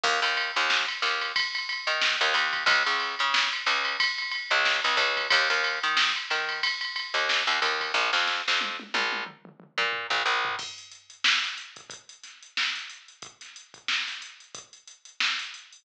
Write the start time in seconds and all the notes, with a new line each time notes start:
0.04 D#2, kick, crash
0.22 D#2, ride
0.37 ride
0.56 D#2, ride
0.70 snare
0.88 snare, ride
1.02 D#2, snare, ride
1.21 ride
1.36 kick, ride
1.55 ride
1.69 ride
1.87 D#3, ride
2.02 snare
2.21 D#2, ride
2.34 D#2, ride
2.53 kick, ride
2.66 C#2, kick, ride
2.86 C#2, ride
3.00 snare, ride
3.19 C#3, ride
3.34 snare
3.52 snare, ride
3.66 C#2, snare, ride
3.85 ride
4.00 kick, ride
4.18 ride
4.31 ride
4.51 C#2, ride
4.65 snare
4.84 C#2, ride
4.97 C#2, kick, snare, ride
5.17 kick, ride
5.30 D#2, kick, ride
5.50 D#2, ride
5.64 ride
5.83 D#3, ride
5.97 snare
6.16 ride
6.30 D#3, snare, ride
6.49 ride
6.63 kick, ride
6.81 ride
6.96 ride
7.14 D#2, ride
7.29 snare
7.47 D#2, ride
7.62 D#2, kick, ride
7.81 kick, ride
7.94 A#1, kick
8.13 F2, snare
8.27 snare
8.48 F2, snare
8.61 high tom
8.80 high tom
8.94 A#1, high tom
9.13 high tom
9.26 mid tom
9.45 mid tom
9.60 mid tom
9.78 A#2, mid tom
9.93 floor tom
10.10 A#1, floor tom
10.26 A#1
10.45 floor tom
10.59 kick, crash
10.78 closed hi-hat
10.91 closed hi-hat
11.10 closed hi-hat
11.24 snare
11.43 snare, closed hi-hat
11.58 closed hi-hat
11.76 kick, closed hi-hat
11.90 kick, closed hi-hat
12.09 closed hi-hat
12.23 snare, closed hi-hat
12.43 closed hi-hat
12.57 snare
12.76 snare, closed hi-hat
12.90 closed hi-hat
13.08 closed hi-hat
13.22 kick, closed hi-hat
13.41 snare, closed hi-hat
13.56 closed hi-hat
13.74 kick, closed hi-hat
13.88 snare
14.07 snare, closed hi-hat
14.22 closed hi-hat
14.40 closed hi-hat
14.55 kick, closed hi-hat
14.73 closed hi-hat
14.88 closed hi-hat
15.05 closed hi-hat
15.20 snare
15.39 closed hi-hat
15.54 closed hi-hat
15.73 open hi-hat